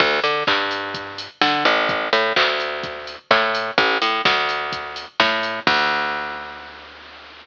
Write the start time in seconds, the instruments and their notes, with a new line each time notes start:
0.00 electric bass (finger) D2, kick, crash
0.24 electric bass (finger) D3, open hi-hat
0.47 electric bass (finger) G2, kick, clap
0.71 open hi-hat
0.94 kick, closed hi-hat
1.18 open hi-hat
1.41 electric bass (finger) D3, kick, snare
1.65 electric bass (finger) A1, open hi-hat
1.89 kick, closed hi-hat
2.13 electric bass (finger) A2, open hi-hat
2.36 electric bass (finger) D2, kick, clap
2.60 open hi-hat
2.83 kick, closed hi-hat
3.07 open hi-hat
3.31 electric bass (finger) A2, kick, clap
3.55 open hi-hat
3.78 electric bass (finger) A1, kick, closed hi-hat
4.02 electric bass (finger) A2, open hi-hat
4.25 electric bass (finger) D2, kick, snare
4.49 open hi-hat
4.72 kick, closed hi-hat
4.96 open hi-hat
5.20 electric bass (finger) A2, kick, snare
5.43 open hi-hat
5.67 electric bass (finger) D2, kick, crash